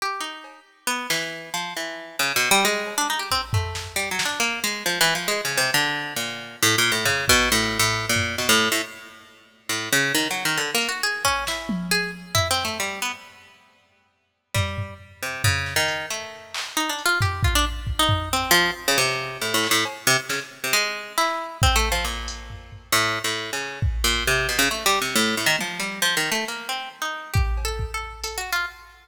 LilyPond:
<<
  \new Staff \with { instrumentName = "Pizzicato Strings" } { \time 5/4 \tempo 4 = 136 g'8 dis'4 r8 b8 e4 f8 e4 | \tuplet 3/2 { cis8 b,8 g8 } gis8. d'16 dis'16 g'16 c'16 r16 a4 \tuplet 3/2 { g8 fis8 d'8 } | ais8 gis8 \tuplet 3/2 { f8 e8 f8 gis8 cis8 c8 } d4 ais,4 | \tuplet 3/2 { a,8 ais,8 a,8 } cis8 b,8 \tuplet 3/2 { a,4 a,4 ais,4 } b,16 a,8 a,16 |
r2 a,8 cis8 \tuplet 3/2 { dis8 fis8 dis8 d8 ais8 fis'8 } | gis'8 cis'8 e'4 gis'8 r8 \tuplet 3/2 { e'8 c'8 a8 } g8 b16 r16 | r2. g4 r8 c8 | cis8. dis8. a4. \tuplet 3/2 { dis'8 d'8 f'8 } g'8 f'16 d'16 |
r8. dis'8. c'8 f8 r16 cis16 c4 \tuplet 3/2 { a,8 a,8 a,8 } | r8 c16 r16 cis16 r8 c16 gis4 e'4 \tuplet 3/2 { c'8 a8 f8 } | ais,2 \tuplet 3/2 { a,4 a,4 cis4 } r8 ais,8 | c8 b,16 cis16 \tuplet 3/2 { a8 g8 c8 } a,8 a,16 dis16 f8 g8 \tuplet 3/2 { f8 dis8 a8 } |
ais8 c'8 r16 dis'8. \tuplet 3/2 { g'4 a'4 a'4 a'8 fis'8 f'8 } | }
  \new DrumStaff \with { instrumentName = "Drums" } \drummode { \time 5/4 r4 cb4 r8 sn8 r4 r4 | r4 r8 cb8 r8 bd8 tomfh8 sn8 hc8 sn8 | hh4 r4 r8 cb8 hh4 r4 | r4 tomfh8 bd8 r4 r8 tomfh8 sn4 |
r4 r4 r4 r4 r8 hh8 | r8 bd8 sn8 tommh8 r4 tomfh4 r4 | r4 r4 r4 tomfh8 tomfh8 r4 | tomfh8 sn8 hh4 r8 hc8 r8 hh8 tomfh8 bd8 |
r8 bd8 tomfh4 cb4 r4 r8 hc8 | cb4 sn4 r4 hc4 bd4 | r8 hh8 tomfh8 tomfh8 r4 r4 bd4 | r4 r4 r4 tommh4 r4 |
r4 r4 bd8 cb8 bd4 hh4 | }
>>